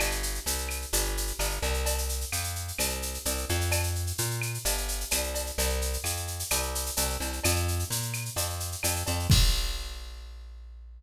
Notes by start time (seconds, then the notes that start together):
0.00 G1, cowbell, claves, shaker
0.11 shaker
0.23 shaker
0.35 shaker
0.46 C2, shaker
0.58 shaker
0.69 claves, shaker
0.82 shaker
0.93 G1, cowbell, shaker
1.05 shaker
1.17 shaker
1.27 shaker
1.39 G1, cowbell, claves, shaker
1.50 shaker
1.62 C2, cowbell, shaker
1.74 shaker
1.86 cowbell, shaker
1.98 shaker
2.09 shaker
2.21 shaker
2.32 F2, claves, shaker
2.44 shaker
2.55 shaker
2.68 shaker
2.78 C2, cowbell, claves, shaker
2.90 shaker
3.02 shaker
3.14 shaker
3.25 C2, cowbell, shaker
3.38 shaker
3.49 F2, cowbell, shaker
3.61 shaker
3.72 cowbell, claves, shaker
3.83 shaker
3.95 shaker
4.07 shaker
4.18 A#2, shaker
4.30 shaker
4.42 claves, shaker
4.54 shaker
4.65 G1, cowbell, shaker
4.78 shaker
4.88 shaker
5.00 shaker
5.11 C2, cowbell, claves, shaker
5.23 shaker
5.34 cowbell, shaker
5.46 shaker
5.58 C2, cowbell, shaker
5.70 shaker
5.81 shaker
5.93 shaker
6.04 F2, claves, shaker
6.17 shaker
6.27 shaker
6.39 shaker
6.50 C2, cowbell, claves, shaker
6.62 shaker
6.75 shaker
6.86 shaker
6.97 C2, cowbell, shaker
7.10 shaker
7.20 C2, cowbell, shaker
7.33 shaker
7.44 F2, cowbell, claves, shaker
7.56 shaker
7.68 shaker
7.79 shaker
7.90 A#2, shaker
8.02 shaker
8.13 claves, shaker
8.25 shaker
8.36 F2, cowbell, shaker
8.50 shaker
8.60 shaker
8.72 shaker
8.83 F2, cowbell, claves, shaker
8.96 shaker
9.06 F2, cowbell, shaker
9.19 shaker
9.30 A#1, kick, crash